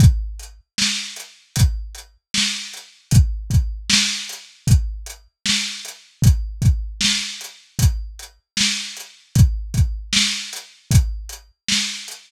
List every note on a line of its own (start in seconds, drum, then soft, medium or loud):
0.00 kick loud
0.00 closed hi-hat loud
0.39 closed hi-hat medium
0.78 snare loud
1.16 closed hi-hat medium
1.56 kick medium
1.56 closed hi-hat loud
1.95 closed hi-hat medium
2.34 snare loud
2.73 closed hi-hat medium
3.11 kick loud
3.11 closed hi-hat loud
3.50 kick medium
3.50 closed hi-hat medium
3.90 snare loud
4.29 closed hi-hat medium
4.67 kick loud
4.67 closed hi-hat loud
5.06 closed hi-hat medium
5.46 snare loud
5.85 closed hi-hat medium
6.22 kick loud
6.22 closed hi-hat loud
6.62 kick medium
6.62 closed hi-hat medium
7.01 snare loud
7.41 closed hi-hat medium
7.79 kick medium
7.79 closed hi-hat loud
8.19 closed hi-hat medium
8.57 snare loud
8.97 closed hi-hat medium
9.35 kick loud
9.35 closed hi-hat loud
9.74 kick medium
9.74 closed hi-hat medium
10.13 snare loud
10.53 closed hi-hat medium
10.91 kick loud
10.91 closed hi-hat loud
11.29 closed hi-hat medium
11.69 snare loud
12.08 closed hi-hat medium